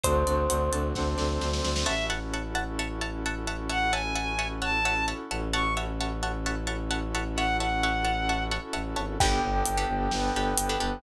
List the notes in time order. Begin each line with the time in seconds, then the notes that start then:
0.04 D2 C4 D4 F#4 A4 C5, kick, closed hi-hat
0.27 D2 D5, closed hi-hat
0.50 D2 F#5, closed hi-hat
0.73 D2 A5, closed hi-hat
0.95 D2 C4 D4 A4 C5 F#5, kick, snare
1.18 D2 D5, snare
1.41 D2 C5, snare
1.53 snare
1.64 D2 D5, snare
1.76 snare
1.86 A1 C#4 E4 F#4 A4 C#5 E5 F#5 A5
2.10 C#5 E5 F#5 A5
2.34 C#5 E5 F#5 A5
2.55 C#5 E5 F#5 A5
2.79 C#5 E5 F#5 A5
3.01 C#5 E5 F#5 A5
3.26 C#5 E5 F#5 A5
3.47 C#5 E5 F#5 A5
3.69 C#5 E5 F#5 A5
3.92 C#5 E5 F#5 G#5 A5
4.16 C#5 E5 F#5 A5
4.39 C#5 E5 F#5 A5
4.62 C#5 E5 F#5 A5
4.85 C#5 E5 F#5 A5
5.08 C#5 E5 F#5 A5
5.31 A1 C#5 E5 F#5 A5
5.53 C#4 E4 F#4 A4 C#5 E5 F#5 A5 C#6
5.77 C#5 E5 F#5 A5
6.01 C#5 E5 F#5 A5
6.23 C#5 E5 F#5 A5
6.46 C#5 E5 F#5 A5
6.67 C#5 E5 F#5 A5
6.91 C#5 E5 F#5 A5
7.15 C#5 E5 F#5 A5
7.36 C#5 E5 F#5 A5
7.60 C#5 E5 F#5 A5
7.83 C#5 E5 F#5 A5
8.05 C#5 E5 F#5 A5
8.29 C#5 E5 F#5 A5
8.51 C#5 E5 F#5 A5
8.73 A1 C#5 E5 F#5 A5
8.96 G#1 C#5 E5 F#5 A5
9.20 G1 B3 D4 G4 A4 B4 G5, kick, crash
9.43 G1
9.66 G1, closed hi-hat
9.77 D4 G4 A4 B4
9.89 G1
10.11 G1 B3 D4 A4 B4, snare
10.35 G1 D4 G4 A4 B4
10.58 G1, closed hi-hat
10.69 D4 G4 A4 B4
10.80 G1 D4 G4 A4 B4